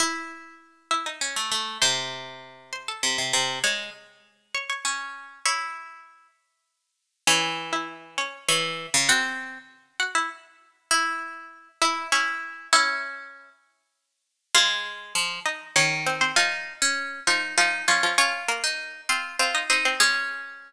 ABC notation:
X:1
M:3/4
L:1/16
Q:1/4=99
K:C#m
V:1 name="Pizzicato Strings"
[Ee]6 [Ee] [Dd] z4 | [^B^b]6 [Bb] [Aa] z4 | [cc']6 [cc'] [cc'] z4 | [cc']6 z6 |
[Cc]3 [Ee]3 [Cc]2 [cc']4 | [Ff]6 [Ff] [Ee] z4 | z6 [Ee]2 [Cc]4 | [Ee]6 z6 |
[K:Db] [Ff]6 [Ee]2 [Dd]2 [Cc] [Cc] | [F,F]6 [F,F]2 [F,F]2 [F,F] [F,F] | [Dd]2 [B,B] z3 [Cc]2 [Cc] [Ee] [Cc] [Cc] | [A,A]6 z6 |]
V:2 name="Pizzicato Strings"
E8 C A, A,2 | ^B,,8 B,, B,, B,,2 | G,2 z6 C4 | E6 z6 |
E,8 E,3 C, | ^B,4 z8 | E6 E2 E4 | C6 z6 |
[K:Db] A,4 F,2 z2 E,4 | E3 D3 E2 E2 D2 | F3 E3 F2 F2 E2 | D6 z6 |]